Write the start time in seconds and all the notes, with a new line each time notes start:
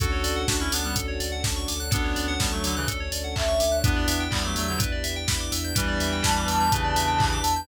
0.00 D2 C#4 D4 F#4 A4, kick, closed hi-hat
0.12 C#5
0.24 D2 D5, open hi-hat
0.36 F#5
0.48 D2 D4 F#4 A5, kick, snare
0.60 C#4 E4 C#6
0.72 D2 B3 D4 D6, open hi-hat
0.84 G3 B3 F#6
0.96 D2 A4, kick, closed hi-hat
1.08 C#5
1.20 D2 D5, open hi-hat
1.32 F#5
1.44 D2 A5, kick, snare
1.56 C#6
1.68 D2 D6, open hi-hat
1.80 F#6
1.91 D2 B3 C#4 D4 F#4 A4 C#5, kick, closed hi-hat
2.04 C#5
2.16 D2 D5, open hi-hat
2.28 F#5
2.40 D2 G3 B3 A5, kick, snare
2.52 F#3 A3 C#6
2.64 D2 D3 F#3 D6, open hi-hat
2.76 C#3 E3 F#6
2.88 D2 A4, kick, closed hi-hat
3.00 C#5
3.12 D2 D5, open hi-hat
3.24 F#5
3.35 D2 E5 A5, kick, clap
3.48 C#6
3.60 D2 D6, open hi-hat
3.72 F#6
3.84 E2 B3 D4 E4 G4 B4, kick, closed hi-hat
3.96 D5
4.08 E2 E5, open hi-hat
4.20 G5
4.31 E2 G3 B3 D4 E4 G4 B5, kick, clap
4.44 F#3 A3 D6
4.56 E2 F#3 A3 E6, open hi-hat
4.68 D3 F#3 G6
4.78 E2 B3 D4 E4 G4 B4, kick, closed hi-hat
4.92 D5
5.04 E2 E5, open hi-hat
5.16 G5
5.28 E2 B3 D4 E4 G4 B5, kick, snare
5.40 D6
5.52 E2 E6, open hi-hat
5.64 G6
5.75 E2 E3 G3 B3 D4 E4 G4 B4, kick, closed hi-hat
5.88 D5
6.00 E2 E5, open hi-hat
6.12 G5
6.23 E2 B3 D4 E4 G4 A5 B5, kick, snare
6.36 D6
6.48 E2 E6, open hi-hat
6.60 G6
6.72 E2 C#3 E3 B3 D4 E4 G4 B4, kick, closed hi-hat
6.84 D5
6.96 E2 E5, open hi-hat
7.08 G5
7.18 E2 B3 D4 E4 G4 B5, kick, clap
7.32 D6
7.44 E2 E6, open hi-hat
7.56 G6